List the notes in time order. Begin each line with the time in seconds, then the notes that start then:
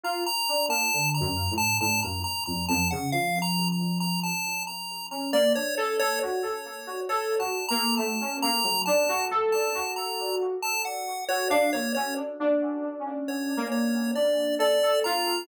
0.03 F4 A#5
0.26 A#5
0.49 D4
0.68 A#3 A5
0.94 D3
1.15 A#5
1.21 F#2
1.51 A2
1.58 A5
1.81 A2 A5
2.03 F#2 A#5
2.24 A#5
2.46 F2 A#5
2.69 F2 A5
2.91 C#3 F#5
3.12 F3 F5
3.42 A#5
3.72 A#5
4.00 A#5
4.24 A5
4.67 A#5
5.11 C#4 A#5
5.33 A#3 D5
5.55 D4 C#5
5.77 A4 C#5
6.00 A4 C#5
6.21 F#4 C#5
6.43 A4
6.87 F#4
7.09 A4 C#5
7.39 F#4 A5
7.69 A#3 A#5
7.97 A3 A5
8.21 C#4
8.42 A#3 A#5
8.64 F#3
8.86 D4 A5
9.09 F#4
9.31 A4
9.52 A5
9.75 F#4
9.96 A#5
10.63 A5
10.85 F#5
11.28 F#4 C#5
11.50 D4 F5
11.73 A#3 C#5
11.95 C#4 C#5
12.40 D4
13.00 C#4
13.28 C#5
13.57 A#3
13.72 C#5
14.15 D4 D5
14.59 A4 D5
14.83 A4
15.04 F4 A#5